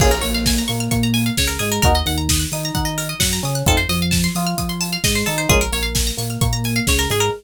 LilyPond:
<<
  \new Staff \with { instrumentName = "Electric Piano 1" } { \time 4/4 \key bes \minor \tempo 4 = 131 <bes des' f' aes'>16 r16 bes4 bes8 bes4 des8 aes8 | <bes ees' ges'>16 r16 ees4 ees'8 ees'4 ges8 des'8 | <a c' ees' f'>16 r16 f4 f'8 f'4 aes8 ees'8 | <aes bes des' f'>16 r16 bes4 bes8 bes4 des8 aes8 | }
  \new Staff \with { instrumentName = "Pizzicato Strings" } { \time 4/4 \key bes \minor aes'16 bes'16 des''16 f''16 aes''16 bes''16 des'''16 f'''16 des'''16 bes''16 aes''16 f''16 des''16 bes'16 aes'16 bes'16 | bes'16 ees''16 ges''16 bes''16 ees'''16 ges'''16 ees'''16 bes''16 ges''16 ees''16 bes'16 ees''16 ges''16 bes''16 ees'''16 ges'''16 | a'16 c''16 ees''16 f''16 a''16 c'''16 ees'''16 f'''16 ees'''16 c'''16 a''16 f''16 ees''16 c''16 a'16 c''16 | aes'16 bes'16 des''16 f''16 aes''16 bes''16 des'''16 f'''16 des'''16 bes''16 aes''16 f''16 des''16 bes'16 aes'16 bes'16 | }
  \new Staff \with { instrumentName = "Synth Bass 1" } { \clef bass \time 4/4 \key bes \minor bes,,8 bes,,4 bes,8 bes,4 des,8 aes,8 | ees,8 ees,4 ees8 ees4 ges,8 des8 | f,8 f,4 f8 f4 aes,8 ees8 | bes,,8 bes,,4 bes,8 bes,4 des,8 aes,8 | }
  \new DrumStaff \with { instrumentName = "Drums" } \drummode { \time 4/4 <cymc bd>16 hh16 hho16 hh16 <bd sn>16 hh16 hho16 hh16 <hh bd>16 hh16 hho16 hh16 <bd sn>16 hh16 hho16 hh16 | <hh bd>16 hh16 hho16 hh16 <bd sn>16 hh16 hho16 hh16 <hh bd>16 hh16 hho16 hh16 <bd sn>16 hh16 hho16 hh16 | <hh bd>16 hh16 hho16 hh16 <bd sn>16 hh16 hho16 hh16 <hh bd>16 hh16 hho16 hh16 <bd sn>16 hh16 hho16 hh16 | <hh bd>16 hh16 hho16 hh16 <bd sn>16 hh16 hho16 hh16 <hh bd>16 hh16 hho16 hh16 <bd sn>16 hh16 hho16 hh16 | }
>>